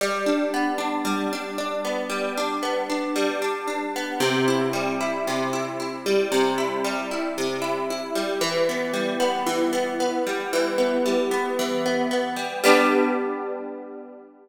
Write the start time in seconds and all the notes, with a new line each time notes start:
0.01 G3
0.26 D4
0.54 B3
0.78 D4
1.05 G3
1.33 D4
1.58 D4
1.85 B3
2.10 G3
2.38 D4
2.63 B3
2.90 D4
3.16 G3
3.42 D4
3.68 D4
3.96 B3
4.20 C3
4.48 E4
4.73 G3
5.01 E4
5.27 C3
5.53 E4
5.80 E4
6.06 G3
6.32 C3
6.58 E4
6.84 G3
7.11 E4
7.38 C3
7.62 E4
7.90 E4
8.15 G3
8.41 E3
8.69 B3
8.93 G3
9.20 B3
9.46 E3
9.73 B3
10.00 B3
10.27 G3
10.53 E3
10.78 B3
11.06 G3
11.31 B3
11.59 E3
11.86 B3
12.11 B3
12.36 G3
12.64 G3 B3 D4